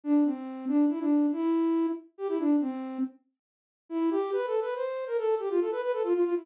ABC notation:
X:1
M:3/4
L:1/16
Q:1/4=140
K:C
V:1 name="Flute"
D2 C4 D2 E D3 | E6 z2 G E D2 | C4 z8 | E2 G2 (3B2 A2 B2 c3 _B |
A2 G F A B B A F F F E |]